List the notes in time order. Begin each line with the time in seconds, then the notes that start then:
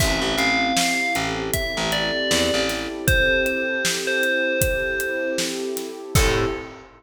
0.00 A1 C4 E5, kick, crash
0.21 A1
0.38 A1 E4 F5, closed hi-hat
0.77 G4, snare
1.15 A1 A4, closed hi-hat
1.53 C4 E5, kick, closed hi-hat
1.77 A1
1.92 E4 D5, snare, closed hi-hat
2.31 E2 G4, snare
2.54 A1
2.69 A4, snare, closed hi-hat
3.08 C4 C5, kick, closed hi-hat
3.46 E4 C5, closed hi-hat
3.84 G4, snare
4.07 C5
4.23 A4, closed hi-hat
4.61 C4, kick, closed hi-hat
5.00 E4, closed hi-hat
5.38 G4, snare
5.77 A4, snare, closed hi-hat
6.15 A2 C4 E4 G4 A4, kick, crash